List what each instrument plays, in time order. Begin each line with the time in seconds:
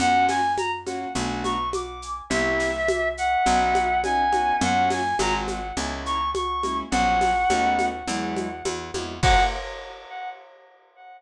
0.00 electric bass (finger) F#2, acoustic grand piano A#3 C#4 F4 F#4, clarinet F#5, low conga, shaker
0.29 clarinet G#5, snare, high conga, shaker
0.58 clarinet A#5, high conga, shaker
0.86 acoustic grand piano A#3 C#4 F4 F#4, high conga, shaker
1.15 electric bass (finger) B1, acoustic grand piano A3 B3 D4 F#4, low conga, shaker
1.44 clarinet C#6, high conga, shaker
1.73 clarinet D6, high conga, shaker
2.02 shaker
2.30 electric bass (finger) C2, acoustic grand piano A#3 C4 E4 G4, clarinet E5, low conga, shaker
2.60 snare, shaker
2.88 high conga, shaker
3.17 clarinet F#5, shaker
3.46 electric bass (finger) B1, acoustic grand piano B3 C#4 D#4 F#4, low conga, shaker
3.75 high conga, shaker
4.04 acoustic grand piano B3 C#4 D#4 F#4, clarinet G#5, high conga, shaker
4.32 acoustic grand piano B3 C#4 D#4 F#4, high conga, shaker
4.61 electric bass (finger) F#2, acoustic grand piano A#3 C#4 F4 F#4, clarinet F#5, low conga, shaker
4.90 clarinet G#5, snare, high conga, shaker
5.19 electric bass (finger) G#1, acoustic grand piano G#3 C4 F4 F#4, clarinet A#5, high conga, shaker
5.48 high conga, shaker
5.77 electric bass (finger) C#2, acoustic grand piano G#3 A#3 C#4 E4, low conga, shaker
6.06 clarinet C#6, shaker
6.34 clarinet C#6, high conga, shaker
6.63 acoustic grand piano G#3 A#3 C#4 E4, high conga, shaker
6.91 electric bass (finger) A#1, acoustic grand piano F#3 A#3 C#4 F4, clarinet F#5, low conga, shaker
7.21 snare, high conga, shaker
7.50 electric bass (finger) D#2, acoustic grand piano A3 B3 C#4 D#4, high conga, shaker
7.79 high conga, shaker
8.07 electric bass (finger) E2, acoustic grand piano F#3 G#3 B3 E4, low conga, shaker
8.36 high conga, shaker
8.65 electric bass (finger) E2, high conga, shaker
8.94 electric bass (finger) F2, acoustic grand piano F#3 G#3 B3 E4, high conga, shaker
9.23 electric bass (finger) F#2, acoustic grand piano A#3 C#4 F4 F#4, clarinet F#5, kick, crash